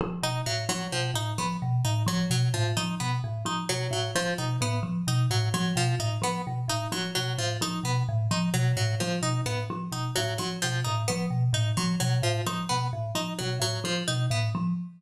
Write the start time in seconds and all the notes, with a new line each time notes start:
0.01 F3
0.23 B2 D#4
0.46 A2 F#3
0.69 F3 F#3
0.92 B2 F3
1.14 A2 D#4
1.38 F3 B3
1.62 B2
1.85 A2 D#4
2.06 F3 F#3
2.30 B2 F#3
2.54 A2 F3
2.77 F3 D#4
3.00 B2 B3
3.24 A2
3.45 F3 D#4
3.69 B2 F#3
3.91 A2 F#3
4.15 F3
4.38 B2 D#4
4.61 A2 B3
4.83 F3
5.07 B2 D#4
5.30 A2 F#3
5.54 F3 F#3
5.76 B2 F3
5.99 A2 D#4
6.22 F3 B3
6.47 B2
6.68 A2 D#4
6.92 F3 F#3
7.15 B2 F#3
7.38 A2 F3
7.61 F3 D#4
7.83 B2 B3
8.09 A2
8.31 F3 D#4
8.54 B2 F#3
8.77 A2 F#3
9.00 F3
9.22 B2 D#4
9.46 A2 B3
9.70 F3
9.92 B2 D#4
10.16 A2 F#3
10.38 F3 F#3
10.62 B2 F3
10.84 A2 D#4
11.08 F3 B3
11.30 B2
11.53 A2 D#4
11.77 F3 F#3
12.00 B2 F#3
12.22 A2 F3
12.47 F3 D#4
12.69 B2 B3
12.93 A2
13.15 F3 D#4
13.39 B2 F#3
13.60 A2 F#3
13.84 F3
14.08 B2 D#4
14.30 A2 B3
14.55 F3